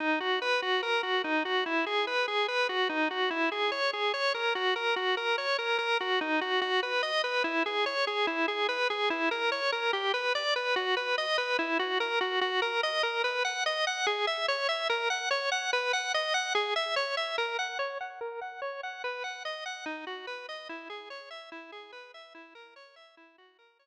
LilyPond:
\new Staff { \time 4/4 \key b \major \tempo 4 = 145 dis'8 fis'8 b'8 fis'8 ais'8 fis'8 dis'8 fis'8 | e'8 gis'8 b'8 gis'8 b'8 fis'8 dis'8 fis'8 | e'8 gis'8 cis''8 gis'8 cis''8 ais'8 fis'8 ais'8 | fis'8 ais'8 cis''8 ais'8 ais'8 fis'8 dis'8 fis'8 |
fis'8 b'8 dis''8 b'8 e'8 gis'8 cis''8 gis'8 | e'8 gis'8 b'8 gis'8 e'8 ais'8 cis''8 ais'8 | g'8 b'8 d''8 b'8 fis'8 b'8 dis''8 b'8 | e'8 fis'8 ais'8 fis'8 fis'8 ais'8 dis''8 ais'8 |
b'8 fis''8 dis''8 fis''8 gis'8 e''8 cis''8 e''8 | ais'8 fis''8 cis''8 fis''8 b'8 fis''8 dis''8 fis''8 | gis'8 e''8 cis''8 e''8 ais'8 fis''8 cis''8 fis''8 | ais'8 fis''8 cis''8 fis''8 b'8 fis''8 dis''8 fis''8 |
dis'8 fis'8 b'8 dis''8 e'8 gis'8 cis''8 e''8 | e'8 gis'8 b'8 e''8 e'8 ais'8 cis''8 e''8 | e'8 fis'8 ais'8 cis''8 r2 | }